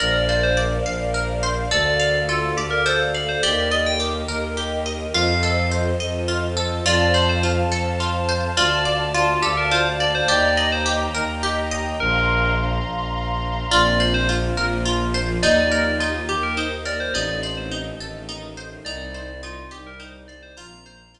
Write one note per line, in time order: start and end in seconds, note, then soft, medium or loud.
0.00 0.78 A#1 medium
0.00 1.70 A#4 medium
0.00 1.14 A#4 medium
0.00 1.70 C5 medium
0.00 0.27 D5 medium
0.00 1.70 D5 medium
0.00 1.70 F5 medium
0.29 1.42 C5 medium
0.29 0.42 D5 medium
0.43 0.57 C5 medium
0.57 1.66 D5 medium
0.86 1.66 A#1 medium
0.86 1.67 F5 medium
1.14 1.68 A#4 medium
1.43 1.70 C5 medium
1.71 2.51 D2 medium
1.71 2.28 A4 loud
1.71 3.42 A4 medium
1.71 2.20 D5 loud
1.71 3.42 D5 medium
1.71 3.42 F5 medium
2.00 3.14 F5 medium
2.29 2.53 F4 medium
2.29 2.85 A4 medium
2.56 3.35 D2 medium
2.56 2.71 G4 medium
2.56 3.39 D5 medium
2.71 2.84 A#4 medium
2.86 3.40 A4 medium
2.86 2.99 C5 loud
3.14 3.28 D5 medium
3.14 3.42 F5 medium
3.29 3.42 C5 medium
3.43 4.24 D#2 medium
3.43 3.99 G4 loud
3.43 5.13 G4 medium
3.43 5.13 A#4 medium
3.43 3.68 D5 loud
3.43 5.13 D#5 medium
3.71 3.85 D5 medium
3.71 4.85 D#5 medium
3.86 4.00 G5 medium
4.00 4.57 G4 medium
4.28 5.06 D#2 medium
4.28 5.10 A#4 medium
4.57 5.11 G4 medium
4.86 5.13 D#5 medium
5.13 5.92 F2 medium
5.13 6.84 F4 medium
5.13 6.28 F4 loud
5.13 6.84 A4 medium
5.13 6.84 C5 medium
5.13 6.84 D#5 medium
5.13 5.67 F5 medium
5.43 6.56 A4 medium
5.71 6.80 C5 medium
6.00 6.80 F2 medium
6.00 6.81 D#5 medium
6.28 6.82 F4 medium
6.57 6.84 A4 medium
6.85 7.64 F2 medium
6.85 7.43 F4 loud
6.85 8.54 C5 medium
6.85 7.13 D5 loud
6.85 8.54 F5 medium
6.85 8.54 A5 medium
7.14 8.28 C5 medium
7.14 7.27 D5 loud
7.29 7.43 C5 loud
7.43 8.00 F4 medium
7.70 8.48 F2 medium
7.70 8.53 A4 medium
8.00 8.54 F4 medium
8.29 8.56 C5 medium
8.56 9.36 D2 medium
8.56 9.14 F4 loud
8.56 10.26 D5 medium
8.56 9.04 D5 loud
8.56 10.26 F5 medium
8.56 10.26 A5 medium
8.85 10.00 D5 medium
9.14 9.42 F4 loud
9.14 9.71 F4 medium
9.42 10.22 D2 medium
9.42 9.56 G4 medium
9.42 10.24 A4 medium
9.57 9.71 A#4 medium
9.71 10.26 F4 medium
9.71 9.85 C5 medium
10.00 10.27 D5 medium
10.00 10.14 D5 medium
10.15 10.28 C5 loud
10.28 11.08 D#2 medium
10.28 10.85 G4 loud
10.28 10.55 D5 loud
10.28 11.98 D#5 medium
10.28 11.98 G5 medium
10.28 11.98 A#5 medium
10.57 10.71 D5 medium
10.57 11.71 D#5 medium
10.72 10.86 C5 loud
10.86 11.43 G4 medium
11.15 11.94 D#2 medium
11.15 11.96 A#4 medium
11.43 11.97 G4 loud
11.71 11.98 D#5 medium
12.00 12.79 A#1 medium
12.00 12.51 A#4 loud
12.00 13.71 F5 medium
12.00 13.71 A#5 medium
12.00 13.71 C6 medium
12.86 13.64 A#1 medium
13.71 14.51 A#1 medium
13.71 14.56 A#3 medium
13.71 14.56 C4 medium
13.71 14.56 F4 medium
13.71 14.28 F4 loud
13.71 13.98 D5 loud
14.00 15.14 C5 medium
14.00 14.13 D5 medium
14.14 14.28 C5 loud
14.29 14.85 F4 medium
14.56 15.37 A#1 medium
14.56 15.41 F3 medium
14.56 15.41 A#3 medium
14.56 15.41 F4 medium
14.56 15.39 A#4 medium
14.85 15.40 F4 medium
15.14 15.41 C5 medium
15.42 16.21 D#2 medium
15.42 16.27 A#3 medium
15.42 16.27 D#4 medium
15.42 16.00 D#4 loud
15.42 16.27 G4 medium
15.42 15.94 D5 loud
15.72 16.85 A#4 medium
16.00 16.57 D#4 medium
16.00 16.24 F4 medium
16.29 17.08 D#2 medium
16.29 17.14 A#3 medium
16.29 17.10 G4 medium
16.29 16.43 G4 loud
16.29 17.14 G4 medium
16.29 17.14 A#4 medium
16.43 16.57 A#4 medium
16.57 17.11 D#4 medium
16.57 16.71 C5 medium
16.85 17.13 A#4 medium
16.85 17.00 D5 medium
17.00 17.14 C5 medium
17.13 17.92 A1 loud
17.13 17.99 A3 medium
17.13 17.99 C4 medium
17.13 17.99 D#4 medium
17.13 17.71 D#4 loud
17.13 17.39 D5 loud
17.43 18.57 C5 medium
17.43 17.56 D5 medium
17.57 17.71 C5 medium
17.71 18.28 D#4 medium
17.98 18.77 A1 medium
17.98 18.85 D#3 medium
17.98 18.85 A3 medium
17.98 18.85 D#4 medium
17.98 18.82 A4 medium
18.29 18.83 D#4 medium
18.57 18.84 C5 medium
18.84 19.63 C2 loud
18.84 19.70 G3 medium
18.84 19.71 C4 medium
18.84 19.70 D#4 medium
18.84 19.43 D#4 loud
18.84 19.40 D5 medium
19.14 20.28 C5 medium
19.43 19.99 D#4 medium
19.43 19.68 F4 loud
19.71 20.51 C2 medium
19.71 20.55 G3 medium
19.71 20.55 D#4 medium
19.71 20.55 G4 medium
19.71 20.53 G4 medium
19.71 19.85 G4 medium
19.87 20.00 A#4 medium
20.00 20.54 D#4 medium
20.00 20.13 C5 medium
20.28 20.56 C5 medium
20.28 20.41 D5 medium
20.43 20.56 C5 loud
20.56 21.20 A#1 medium
20.56 21.20 F3 medium
20.56 21.20 A#3 medium
20.56 21.20 C4 medium
20.56 21.14 F4 loud
20.56 21.11 A#5 loud
20.86 21.20 C5 medium
21.14 21.20 F4 medium